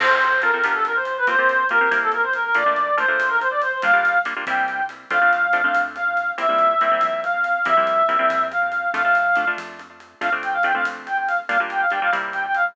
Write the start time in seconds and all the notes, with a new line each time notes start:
0.00 F2 C4 F4 A4 C5, crash
0.10 C4 F4 A4
0.22 closed hi-hat
0.42 C4 F4 A4 A#4, closed hi-hat
0.54 C4 F4 A4
0.64 G1 B3 D4 F4 G4, closed hi-hat
0.74 A4
0.85 A#4, closed hi-hat
0.95 C5
1.05 C5, closed hi-hat
1.18 B4
1.27 C2 A#3 C4 F4 G4 C5, closed hi-hat
1.38 A#3 C4 F4 G4
1.49 closed hi-hat
1.69 A#3 C4 F4 G4 A#4, closed hi-hat
1.81 A#3 C4 F4 G4
1.91 C2 A#3 C4 E4 G4, closed hi-hat
2.02 A4
2.12 A#4, closed hi-hat
2.23 C5
2.33 A#4, closed hi-hat
2.45 A#4
2.55 A#1 A3 A#3 D4 F4 D5, closed hi-hat
2.66 A3 A#3 D4 F4
2.76 closed hi-hat
2.97 A3 A#3 D4 F4 C5, closed hi-hat
3.08 A3 A#3 D4 F4
3.19 A#1, closed hi-hat
3.30 A#4
3.40 C5, closed hi-hat
3.51 D5
3.62 C5, closed hi-hat
3.72 C5
3.82 G1 G3 A#3 D4 F4 F5, closed hi-hat
3.93 G3 A#3 D4 F4
4.05 closed hi-hat
4.25 G3 A#3 D4 F4, closed hi-hat
4.36 G3 A#3 D4 F4
4.47 C2 G3 A#3 C4 E4 G5, closed hi-hat
4.68 closed hi-hat
4.89 closed hi-hat
5.10 F2 A3 C4 D4 F4 F5, closed hi-hat
5.21 A3 C4 D4 F4
5.33 closed hi-hat
5.53 A3 C4 D4 F4, closed hi-hat
5.64 A3 C4 D4 F4
5.75 F2, closed hi-hat
5.95 F5, closed hi-hat
6.17 closed hi-hat
6.38 F2 G3 A#3 C4 E4 E5, closed hi-hat
6.49 G3 A#3 C4 E4
6.59 closed hi-hat
6.81 G3 A#3 C4 E4, closed hi-hat
6.91 G3 A#3 C4 E4
7.01 F2, closed hi-hat
7.24 F5, closed hi-hat
7.44 closed hi-hat
7.65 F2 G3 A#3 C4 E4 E5, closed hi-hat
7.77 G3 A#3 C4 E4
7.87 closed hi-hat
8.09 G3 A#3 C4 E4, closed hi-hat
8.19 G3 A#3 C4 E4
8.30 F2, closed hi-hat
8.52 F5, closed hi-hat
8.72 closed hi-hat
8.94 F2 A3 D4 F4 F5, closed hi-hat
9.04 A3 D4 F4
9.15 closed hi-hat
9.36 A3 D4 F4, closed hi-hat
9.47 A3 D4 F4
9.57 F2, closed hi-hat
9.79 closed hi-hat
10.00 closed hi-hat
10.21 F2 A3 C4 D4 F4 F5, closed hi-hat
10.32 A3 C4 D4 F4
10.43 G5, closed hi-hat
10.53 F5
10.63 A3 C4 D4 F4 G5, closed hi-hat
10.74 A3 C4 D4 F4 F5
10.85 F2, closed hi-hat
11.07 G5, closed hi-hat
11.17 G5
11.27 F5, closed hi-hat
11.49 G1 G3 A#3 D4 F4 F5, closed hi-hat
11.60 G3 A#3 D4 F4
11.70 G5, closed hi-hat
11.81 F5
11.90 G3 A#3 D4 F4 G5, closed hi-hat
12.02 G3 A#3 D4 F4 F5
12.12 C2 G3 A#3 C4 E4, closed hi-hat
12.33 G5, closed hi-hat
12.45 G5
12.55 F5, closed hi-hat